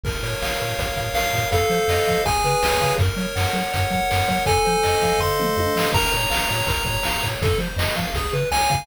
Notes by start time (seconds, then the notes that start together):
0.04 A#1 A#4, kick, crash
0.23 A#2 C#5, closed hi-hat
0.42 A#1 F5, snare
0.60 A#2 A#4, closed hi-hat
0.79 A#1 C#5, kick, closed hi-hat
0.96 A#2 F5, kick, closed hi-hat
1.14 A#1 A#4 F5, snare
1.33 A#2 C#5, kick, closed hi-hat
1.52 F2 A4 F5, kick, closed hi-hat
1.70 F3 C5, closed hi-hat
1.88 F2 D#5, snare
2.07 F3 F5, kick, closed hi-hat
2.25 C#2 G#4 G#5, kick, closed hi-hat
2.43 C#3 B4, closed hi-hat
2.63 C#2 C#5, snare
2.81 C#3 F5, kick, closed hi-hat
2.98 F#2 A#4, kick, closed hi-hat
3.17 F#3 C#5, closed hi-hat
3.36 F#2 F#5, snare
3.53 F#3 A#4, closed hi-hat
3.73 F#2 C#5, kick, closed hi-hat
3.90 F#3 F#5, kick, closed hi-hat
4.10 F#2 A#4, snare
4.27 F#3 C#5, kick, closed hi-hat
4.46 F2 A4 G#5, kick, closed hi-hat
4.65 F3 C5, closed hi-hat
4.83 F2 D#5, snare
5.01 F3 F5, kick, closed hi-hat
5.19 F2 A4 C6, kick, floor tom
5.38 F3 C5, mid tom
5.57 F2 D#5, high tom
5.75 F3 F5, snare
5.93 A#1 A#4 A#5, kick, crash
6.12 A#2 C#5, closed hi-hat
6.30 A#1 F5, snare
6.49 A#2 C#5, closed hi-hat
6.67 A#1 A#4, kick, closed hi-hat
6.85 A#2 C#5, kick, closed hi-hat
7.03 A#1 F5, snare
7.22 A#2 C#5, kick, closed hi-hat
7.42 F2 A4, kick, closed hi-hat
7.58 F3 C5, closed hi-hat
7.76 F2 D#5, snare
7.96 F3 F5, kick, closed hi-hat
8.14 C#2 G#4, kick, closed hi-hat
8.32 C#3 B4, closed hi-hat
8.51 C#2 C#5 G#5, snare
8.70 C#3 F5, kick, closed hi-hat